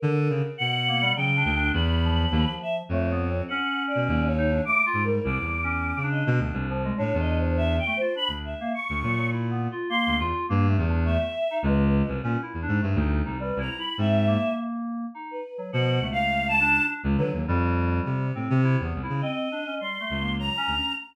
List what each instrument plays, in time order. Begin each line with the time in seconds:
0.00 clarinet D3, choir aahs A#4
0.29 clarinet C#3
0.58 clarinet B2, choir aahs F#5
0.88 electric piano 2 A#3
1.01 electric piano 2 G3
1.16 clarinet C#3, electric piano 2 F#3, choir aahs G5
1.36 electric piano 2 D4
1.45 clarinet D2
1.55 electric piano 2 D4
1.73 clarinet E2, choir aahs B5
2.04 electric piano 2 F3
2.31 clarinet D#2
2.62 choir aahs E5
2.89 clarinet F2, electric piano 2 A3, choir aahs C#5
3.11 electric piano 2 B3
3.29 electric piano 2 C4
3.48 electric piano 2 C#4, choir aahs F#5
3.87 choir aahs D5
3.95 clarinet B2
4.08 clarinet D#2
4.27 choir aahs C#5
4.38 electric piano 2 D#4
4.51 electric piano 2 D4
4.65 electric piano 2 A3, choir aahs D6
4.85 electric piano 2 F4, choir aahs D6
4.93 clarinet G#2
5.04 electric piano 2 G3, choir aahs A#4
5.23 clarinet C2, electric piano 2 E4, choir aahs D6
5.40 clarinet E2
5.64 electric piano 2 C#4
5.97 clarinet C#3
6.03 electric piano 2 D4
6.11 choir aahs D#5
6.27 clarinet B2
6.38 clarinet D2, electric piano 2 D4
6.53 clarinet C2
6.70 electric piano 2 F3
6.84 electric piano 2 G#3
6.97 clarinet A2, electric piano 2 D4, choir aahs C#5
7.14 clarinet E2
7.20 choir aahs D#5
7.38 choir aahs C5
7.57 choir aahs E5
7.79 choir aahs G5
7.87 electric piano 2 A3
7.97 choir aahs C5
8.01 electric piano 2 F4
8.15 electric piano 2 D4, choir aahs B5
8.28 clarinet D2
8.45 choir aahs E5
8.60 electric piano 2 A#3
8.74 choir aahs C#6
8.89 clarinet D2
9.02 clarinet A#2, electric piano 2 F#3
9.17 electric piano 2 F#3
9.32 electric piano 2 E4
9.51 electric piano 2 B3
9.71 electric piano 2 F4
9.89 electric piano 2 A#3, choir aahs C6
10.07 clarinet D2
10.19 clarinet E2, electric piano 2 F4
10.49 clarinet G2, electric piano 2 A#3
10.68 electric piano 2 A3
10.78 clarinet E2
10.88 electric piano 2 D4
11.05 electric piano 2 A3, choir aahs E5
11.51 electric piano 2 D#4
11.63 clarinet C#2, electric piano 2 G#3, choir aahs B4
12.08 clarinet C2
12.23 clarinet A#2, electric piano 2 C#4
12.42 electric piano 2 E4
12.54 clarinet E2
12.62 electric piano 2 D4
12.68 clarinet G#2
12.81 clarinet G2, electric piano 2 A3
12.95 clarinet D2, electric piano 2 D#4
13.25 clarinet C2, electric piano 2 D#4
13.40 electric piano 2 G3, choir aahs B4
13.56 clarinet C2, electric piano 2 E4
13.60 choir aahs A#5
13.78 electric piano 2 E4, choir aahs B5
13.98 clarinet G#2, electric piano 2 C4, choir aahs E5
14.27 electric piano 2 A#3
15.15 electric piano 2 D#4
15.31 choir aahs B4
15.58 electric piano 2 F#3
15.73 clarinet B2, electric piano 2 F3, choir aahs F#5
16.00 clarinet C#2, electric piano 2 A3
16.12 choir aahs F5
16.48 choir aahs A5
16.60 electric piano 2 D4
16.88 electric piano 2 D4
17.04 clarinet C#2
17.17 clarinet D3, electric piano 2 F#3, choir aahs B4
17.33 clarinet D#2
17.48 clarinet F2, electric piano 2 G3
18.05 clarinet C3
18.35 clarinet A2, electric piano 2 C4
18.50 clarinet C3
18.64 electric piano 2 E4
18.80 clarinet E2, electric piano 2 B3
18.95 clarinet C2
19.03 electric piano 2 E4
19.09 clarinet C#3
19.21 electric piano 2 C4, choir aahs D#5
19.52 electric piano 2 D4
19.66 electric piano 2 C#4
19.80 electric piano 2 G3, choir aahs C6
20.00 electric piano 2 A3
20.10 clarinet C#2
20.20 electric piano 2 A#3
20.39 electric piano 2 F#3, choir aahs A#5
20.57 electric piano 2 C#4
20.67 clarinet D2
20.77 electric piano 2 C#4